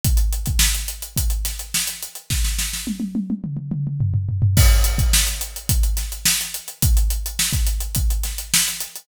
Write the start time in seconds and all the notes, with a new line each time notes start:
0.04 kick, closed hi-hat
0.17 closed hi-hat
0.33 closed hi-hat
0.46 kick, closed hi-hat
0.59 snare
0.75 closed hi-hat
0.88 closed hi-hat
1.02 closed hi-hat
1.17 kick, closed hi-hat
1.30 closed hi-hat
1.45 snare, closed hi-hat
1.59 closed hi-hat
1.74 snare
1.87 closed hi-hat
2.03 closed hi-hat
2.15 closed hi-hat
2.30 kick, snare
2.44 snare
2.59 snare
2.73 snare
2.87 high tom
3.00 high tom
3.15 high tom
3.30 high tom
3.44 mid tom
3.57 mid tom
3.71 mid tom
3.87 mid tom
4.00 floor tom
4.14 floor tom
4.29 floor tom
4.42 floor tom
4.57 kick, crash
4.84 closed hi-hat
4.98 kick, closed hi-hat
5.13 snare
5.27 closed hi-hat
5.41 closed hi-hat
5.56 closed hi-hat
5.69 kick, closed hi-hat
5.83 closed hi-hat
5.97 snare, closed hi-hat
6.12 closed hi-hat
6.25 snare
6.41 closed hi-hat
6.54 closed hi-hat
6.68 closed hi-hat
6.82 kick, closed hi-hat
6.97 closed hi-hat
7.10 closed hi-hat
7.26 closed hi-hat
7.39 snare
7.53 kick, closed hi-hat
7.67 closed hi-hat
7.81 closed hi-hat
7.95 kick, closed hi-hat
8.10 closed hi-hat
8.24 snare, closed hi-hat
8.38 closed hi-hat
8.54 snare
8.68 closed hi-hat
8.81 closed hi-hat
8.96 closed hi-hat